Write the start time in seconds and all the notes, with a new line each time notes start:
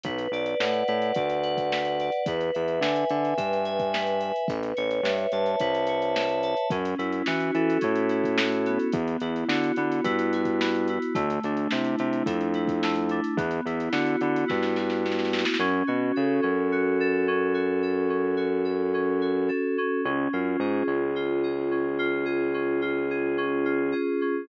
0.03 B1 B4, kick, closed hi-hat
0.18 closed hi-hat
0.31 B1 D5, closed hi-hat
0.46 closed hi-hat
0.60 A2 F#5, snare
0.73 closed hi-hat
0.88 A2 B4, closed hi-hat
1.02 closed hi-hat
1.14 D2 D5, kick, closed hi-hat
1.30 closed hi-hat
1.43 F#5, closed hi-hat
1.57 kick, closed hi-hat
1.72 B4, snare
1.85 closed hi-hat
2.00 D5, closed hi-hat
2.12 closed hi-hat
2.26 E2 B4, kick, closed hi-hat
2.41 closed hi-hat
2.54 E2 E5, closed hi-hat
2.68 closed hi-hat
2.81 D3 G#5, snare
2.96 closed hi-hat
3.09 D3 B4, closed hi-hat
3.25 closed hi-hat
3.37 G2 E5, kick, closed hi-hat
3.53 closed hi-hat
3.65 G#5, closed hi-hat
3.80 kick, closed hi-hat
3.93 B4, snare
4.07 closed hi-hat
4.21 E5, closed hi-hat
4.36 closed hi-hat
4.48 A1 B4, kick, closed hi-hat
4.63 closed hi-hat
4.77 A1 C#5, closed hi-hat
4.91 closed hi-hat
5.03 G2 E5, snare
5.18 closed hi-hat
5.32 G2 A5, closed hi-hat
5.46 closed hi-hat
5.59 C2 B4, kick, closed hi-hat
5.75 closed hi-hat
5.87 C#5, closed hi-hat
6.02 closed hi-hat
6.15 E5, snare
6.29 closed hi-hat
6.43 A5, closed hi-hat
6.57 closed hi-hat
6.70 F#2 C#4, kick, closed hi-hat
6.85 closed hi-hat
6.98 F#2 E4, closed hi-hat
7.12 closed hi-hat
7.26 E3 F#4, snare
7.40 closed hi-hat
7.54 E3 A4, closed hi-hat
7.70 closed hi-hat
7.81 A2 C#4, kick, closed hi-hat
7.95 closed hi-hat
8.09 E4, closed hi-hat
8.24 kick, closed hi-hat
8.38 F#4, snare
8.52 closed hi-hat
8.66 B3, closed hi-hat
8.79 closed hi-hat
8.92 E2, kick, closed hi-hat
9.08 closed hi-hat
9.20 E2 E4, closed hi-hat
9.36 closed hi-hat
9.48 D3 F#4, snare
9.64 closed hi-hat
9.76 D3 B3, closed hi-hat
9.92 closed hi-hat
10.04 G2 E4, kick, closed hi-hat
10.19 closed hi-hat
10.33 F#4, closed hi-hat
10.45 kick, closed hi-hat
10.61 B3, snare
10.75 closed hi-hat
10.88 E4, closed hi-hat
11.02 closed hi-hat
11.15 D2 A3, kick, closed hi-hat
11.30 closed hi-hat
11.43 D2 D4, closed hi-hat
11.57 closed hi-hat
11.71 C3 E4, snare
11.84 closed hi-hat
11.98 C3 A3, closed hi-hat
12.13 closed hi-hat
12.26 F2 D4, kick, closed hi-hat
12.41 closed hi-hat
12.54 E4, closed hi-hat
12.67 kick, closed hi-hat
12.83 A3, snare
12.95 closed hi-hat
13.09 D4, closed hi-hat
13.24 closed hi-hat
13.37 E2 B3, kick, closed hi-hat
13.51 closed hi-hat
13.66 E2 E4, closed hi-hat
13.80 closed hi-hat
13.92 D3 F#4, snare
14.06 closed hi-hat
14.21 D3 B3, closed hi-hat
14.36 closed hi-hat
14.48 G2 E4, kick, snare
14.63 snare
14.76 F#4, snare
14.90 snare
15.05 B3, snare
15.12 snare
15.19 snare
15.25 snare
15.32 E4, snare
15.39 snare
15.45 snare
15.54 snare
15.59 F#2 C#4
15.87 B2 F#4
16.16 C#3 A4
16.42 F#2 C#4
16.72 F#4
17.00 A4
17.28 C#4
17.54 F#4
17.83 A4
18.09 C#4
18.37 F#4
18.65 A4
18.94 C#4
19.21 F#4
19.48 A4
19.78 C#4
20.05 C#2 C#4
20.33 F#2 F4
20.59 G#2 G#4
20.87 C#2 C#4
21.16 F4
21.43 G#4
21.71 C#4
21.99 F4
22.25 G#4
22.54 C#4
22.82 F4
23.10 G#4
23.38 C#4
23.65 F4
23.92 G#4
24.21 C#4